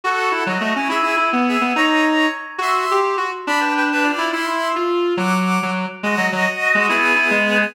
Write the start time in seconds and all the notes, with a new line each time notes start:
0.04 F#4 A4 F#5
0.31 E4
0.46 F#3 F#4 D#5
0.61 A3
0.76 C#4 E4 C#5
0.89 E4 G#4 E5
1.03 E4
1.17 E4
1.33 B3
1.48 G#4 E5
1.61 B3
1.76 D#4 C#5 A#5
2.58 F#4 E5 C6
2.91 G4
3.17 F#4
3.47 D4 D5 B5
3.60 B4 G5
3.77 B4 G5
3.92 D4 B4
4.03 F4 D5
4.18 E4
4.32 E4 E5 C6
4.47 E4
4.76 F4
5.17 F#3 F#5 D6
5.62 F#3
6.03 G#3 F#4 D#5
6.17 F#3
6.32 F#3
6.75 G#3
6.89 B3 E4 G#4
7.16 E4
7.31 G#3
7.61 B3 G#4